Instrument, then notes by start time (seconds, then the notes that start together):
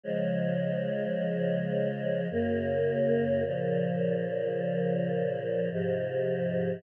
choir aahs
0.03 C#3 F3 G#3
2.31 F#2 C#3 A#3
3.45 A#2 C#3 F3
5.71 G#2 C3 F3